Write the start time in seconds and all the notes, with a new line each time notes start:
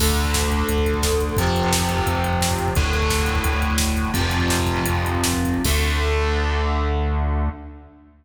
0.00 D2 D3 A3, kick, crash
0.10 kick
0.16 kick, closed hi-hat
0.25 kick
0.34 kick, snare
0.43 kick
0.51 kick, closed hi-hat
0.59 kick
0.69 D2, kick, closed hi-hat
0.78 kick
0.86 kick, closed hi-hat
0.94 kick
1.03 kick, snare
1.12 kick
1.20 kick, closed hi-hat
1.29 kick
1.37 F2 C3 F3, kick, closed hi-hat
1.47 kick
1.56 kick, closed hi-hat
1.63 kick
1.73 kick, snare
1.80 kick
1.89 kick, closed hi-hat
1.98 kick
2.06 F2, kick, closed hi-hat
2.15 kick
2.24 kick, closed hi-hat
2.33 kick
2.41 kick, snare
2.51 kick
2.58 kick, closed hi-hat
2.68 kick
2.75 D2 A2 D3, kick, closed hi-hat
2.84 kick
2.93 kick, closed hi-hat
3.02 kick
3.10 kick, snare
3.20 kick
3.26 kick, closed hi-hat
3.35 kick
3.44 D2, kick, closed hi-hat
3.53 kick
3.62 kick, closed hi-hat
3.70 kick
3.78 kick, snare
3.86 kick
3.96 kick, closed hi-hat
4.05 kick
4.14 F2 C3 F3, kick, closed hi-hat
4.21 kick
4.30 kick, closed hi-hat
4.40 kick
4.48 kick, snare
4.59 kick
4.66 kick, closed hi-hat
4.76 kick
4.86 F2, kick, closed hi-hat
4.95 kick
5.05 kick, closed hi-hat
5.15 kick
5.24 kick, snare
5.33 kick
5.45 kick, closed hi-hat
5.54 kick
5.64 D2 D3 A3, kick, crash